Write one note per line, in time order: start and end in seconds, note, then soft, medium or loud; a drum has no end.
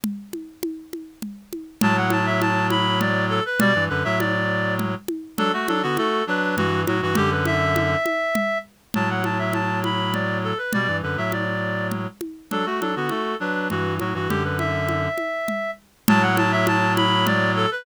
0.04 low conga medium
0.33 high conga medium
0.63 high conga medium
0.93 high conga medium
1.22 low conga medium
1.53 high conga medium
1.81 3.40 A2 medium
1.81 3.40 F#3 medium
1.81 1.96 A5 loud
1.81 low conga loud
1.97 2.11 F#5 medium
2.10 2.26 A5 loud
2.10 high conga medium
2.26 2.40 E5 loud
2.41 2.67 A5 loud
2.41 high conga medium
2.70 2.99 B5 loud
2.70 high conga medium
3.00 3.25 D5 loud
3.00 low conga medium
3.29 3.44 A4 loud
3.46 3.60 B4 loud
3.59 3.73 B2 medium
3.59 3.73 G3 medium
3.59 3.84 D5 loud
3.59 low conga loud
3.75 3.89 G2 medium
3.75 3.89 E3 medium
3.89 4.04 F#2 medium
3.89 4.04 D3 medium
3.89 4.03 B4 loud
4.04 4.95 A2 medium
4.04 4.95 F#3 medium
4.04 4.18 E5 loud
4.19 4.74 D5 loud
4.19 high conga medium
4.79 low conga medium
5.08 high conga medium
5.37 5.52 F#3 medium
5.37 5.52 D4 medium
5.37 5.52 A4 loud
5.37 low conga medium
5.53 5.67 A3 medium
5.53 5.67 F#4 medium
5.68 5.82 F#3 medium
5.68 5.82 D4 medium
5.68 5.82 A4 loud
5.68 high conga medium
5.82 5.97 D3 medium
5.82 5.97 B3 medium
5.82 5.96 F#4 loud
5.97 6.23 A3 medium
5.97 6.23 F#4 medium
5.97 6.24 A4 loud
5.97 high conga medium
6.27 6.56 F#3 medium
6.27 6.56 D4 medium
6.27 6.55 B4 medium
6.56 6.85 G2 medium
6.56 6.85 E3 medium
6.56 6.81 F#4 loud
6.56 low conga medium
6.87 7.01 A2 medium
6.87 7.01 F#3 medium
6.87 7.01 F#4 medium
6.87 high conga medium
7.02 7.16 G2 medium
7.02 7.16 E3 medium
7.02 7.16 F#4 loud
7.15 7.96 F#2 medium
7.15 7.96 D3 medium
7.15 7.30 G4 loud
7.15 low conga loud
7.31 7.45 B4 medium
7.45 8.58 E5 loud
7.45 high conga medium
7.76 high conga medium
8.06 high conga medium
8.35 low conga medium
8.94 10.53 A2 medium
8.94 10.53 F#3 medium
8.94 9.09 A5 medium
8.94 low conga medium
9.10 9.24 F#5 medium
9.24 9.38 A5 medium
9.24 high conga medium
9.39 9.53 E5 medium
9.53 9.79 A5 medium
9.53 high conga medium
9.84 10.13 B5 medium
9.84 high conga medium
10.13 10.38 D5 medium
10.13 low conga medium
10.44 10.58 A4 medium
10.58 10.72 B4 medium
10.73 10.87 B2 medium
10.73 10.87 G3 medium
10.73 10.97 D5 loud
10.73 low conga medium
10.88 11.02 G2 medium
10.88 11.02 E3 medium
11.02 11.17 F#2 medium
11.02 11.17 D3 medium
11.02 11.17 B4 medium
11.17 12.07 A2 medium
11.17 12.07 F#3 medium
11.17 11.32 E5 medium
11.32 11.87 D5 medium
11.32 high conga medium
11.91 low conga medium
12.21 high conga medium
12.51 12.65 F#3 medium
12.51 12.65 D4 medium
12.51 12.66 A4 medium
12.51 low conga medium
12.66 12.80 A3 medium
12.66 12.80 F#4 medium
12.80 12.95 F#3 medium
12.80 12.95 D4 medium
12.80 12.95 A4 medium
12.80 high conga medium
12.96 13.10 D3 soft
12.96 13.10 B3 medium
12.96 13.10 F#4 medium
13.09 13.35 A3 medium
13.09 13.35 F#4 medium
13.09 13.36 A4 medium
13.09 high conga medium
13.40 13.68 F#3 medium
13.40 13.68 D4 medium
13.40 13.68 B4 medium
13.70 13.99 G2 medium
13.70 13.99 E3 medium
13.70 13.94 F#4 medium
13.70 low conga medium
14.00 14.14 A2 medium
14.00 14.14 F#3 medium
14.00 14.14 F#4 medium
14.00 high conga medium
14.14 14.28 G2 medium
14.14 14.28 E3 medium
14.14 14.29 F#4 medium
14.29 15.08 F#2 medium
14.29 15.08 D3 medium
14.29 14.43 G4 medium
14.29 low conga medium
14.44 14.58 B4 medium
14.59 15.71 E5 medium
14.59 high conga medium
14.88 high conga medium
15.18 high conga medium
15.48 low conga medium
16.08 17.66 A2 medium
16.08 17.66 F#3 medium
16.08 16.22 A5 loud
16.08 low conga loud
16.22 16.36 F#5 loud
16.37 16.51 A5 loud
16.37 high conga medium
16.52 16.66 E5 loud
16.67 16.93 A5 loud
16.67 high conga medium
16.97 17.25 B5 loud
16.97 high conga medium
17.26 17.51 D5 loud
17.26 low conga medium
17.56 17.70 A4 loud
17.71 17.85 B4 loud